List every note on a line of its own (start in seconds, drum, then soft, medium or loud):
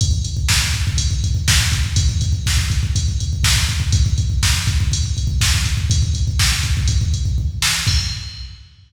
0.01 kick loud
0.01 closed hi-hat loud
0.11 kick medium
0.24 kick medium
0.24 closed hi-hat medium
0.37 kick medium
0.49 kick medium
0.49 snare loud
0.62 kick medium
0.73 kick medium
0.73 closed hi-hat medium
0.87 kick loud
0.97 kick medium
0.97 closed hi-hat loud
1.11 kick medium
1.24 kick medium
1.24 closed hi-hat medium
1.35 kick medium
1.48 kick loud
1.48 snare loud
1.61 kick medium
1.72 kick loud
1.72 closed hi-hat medium
1.84 kick medium
1.96 kick loud
1.96 closed hi-hat loud
2.09 kick medium
2.21 kick medium
2.21 closed hi-hat medium
2.33 kick medium
2.46 kick medium
2.46 snare loud
2.57 kick medium
2.70 kick loud
2.70 closed hi-hat medium
2.83 kick medium
2.95 kick loud
2.95 closed hi-hat loud
3.08 kick medium
3.20 kick medium
3.20 closed hi-hat medium
3.33 kick medium
3.44 kick loud
3.44 snare loud
3.56 kick medium
3.69 kick medium
3.69 closed hi-hat medium
3.80 kick medium
3.92 kick loud
3.92 closed hi-hat loud
4.06 kick medium
4.18 kick medium
4.18 closed hi-hat medium
4.30 kick medium
4.43 kick loud
4.43 snare loud
4.54 kick medium
4.67 kick loud
4.67 closed hi-hat medium
4.80 kick loud
4.92 kick medium
4.92 closed hi-hat loud
5.04 kick medium
5.17 kick medium
5.17 closed hi-hat medium
5.27 kick loud
5.41 kick loud
5.41 snare loud
5.54 kick medium
5.64 kick medium
5.64 closed hi-hat medium
5.77 kick medium
5.90 kick loud
5.90 closed hi-hat loud
6.02 kick medium
6.14 kick medium
6.14 closed hi-hat medium
6.28 kick medium
6.39 kick medium
6.39 snare loud
6.52 kick medium
6.63 kick medium
6.63 closed hi-hat medium
6.77 kick loud
6.87 kick loud
6.87 closed hi-hat loud
7.01 kick loud
7.13 kick medium
7.13 closed hi-hat medium
7.25 kick medium
7.38 kick medium
7.62 snare loud
7.87 kick loud
7.87 crash loud